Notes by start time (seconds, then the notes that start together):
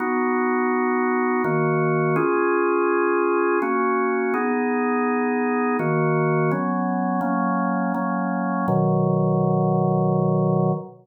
0.00 B3 D#4 F#4
1.44 D#3 A#3 F#4
2.16 C#4 F4 G#4
3.62 A#3 C#4 F#4
4.34 B3 D#4 G#4
5.79 D#3 A#3 F#4
6.51 F#3 B3 C#4
7.21 F#3 A#3 C#4
7.94 F#3 A#3 C#4
8.68 B2 D#3 F#3